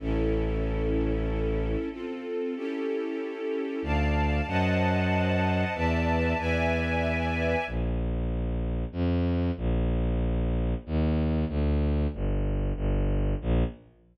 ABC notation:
X:1
M:3/4
L:1/8
Q:1/4=94
K:A
V:1 name="String Ensemble 1"
[CEA]6 | [=C=FA]2 [^CE=GA]4 | [d=fa]2 [=c^d^fa]4 | [Bdea]2 [Bdeg]4 |
[K:Bb] z6 | z6 | z6 | z6 |]
V:2 name="Violin" clef=bass
A,,,6 | z6 | D,,2 F,,4 | E,,2 E,,4 |
[K:Bb] B,,,4 F,,2 | B,,,4 E,,2 | D,,2 G,,,2 G,,,2 | B,,,2 z4 |]